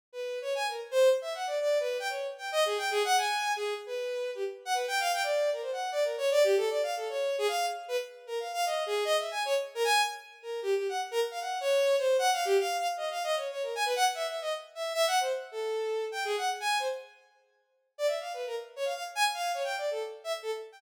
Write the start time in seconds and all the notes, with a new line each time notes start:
0.13 B4
0.42 C#5
0.55 G#5
0.69 A#4
0.91 C5
1.22 E5
1.35 F#5
1.47 D5
1.61 D5
1.80 B4
2.00 G5
2.09 C#5
2.38 G5
2.52 D#5
2.66 G#4
2.78 G5
2.91 G#4
3.05 F#5
3.17 G#5
3.56 G#4
3.86 B4
4.35 G4
4.65 F#5
4.74 B4
4.88 G5
5.00 F5
5.14 G5
5.23 D5
5.53 A#4
5.62 C5
5.72 F#5
5.92 D5
6.04 A#4
6.18 C#5
6.31 D5
6.44 G4
6.57 A4
6.70 D5
6.83 F5
6.96 A4
7.09 C#5
7.38 G#4
7.48 F5
7.88 B4
8.27 A#4
8.40 F5
8.53 F5
8.66 D#5
8.86 G#4
9.05 D#5
9.19 E5
9.31 G#5
9.45 C#5
9.75 A#4
9.84 G#5
10.43 A#4
10.62 G4
10.75 G4
10.89 F#5
11.11 A#4
11.31 F5
11.41 F#5
11.61 C#5
11.99 C5
12.19 F#5
12.33 F5
12.45 G4
12.59 F5
12.79 F5
12.97 D#5
13.11 F5
13.24 D#5
13.36 C#5
13.51 C#5
13.63 A#4
13.75 G#5
13.85 B4
13.96 F#5
14.15 E5
14.28 E5
14.41 D#5
14.75 E5
14.94 E5
15.07 F#5
15.20 C5
15.52 A4
16.12 G5
16.25 G#4
16.38 F#5
16.60 G#5
16.79 C5
17.98 D5
18.07 E5
18.21 F5
18.34 B4
18.47 A#4
18.76 C#5
18.85 F5
18.95 F5
19.15 G#5
19.34 F5
19.54 C#5
19.64 G5
19.78 D5
19.91 A4
20.24 E5
20.42 A4
20.72 G5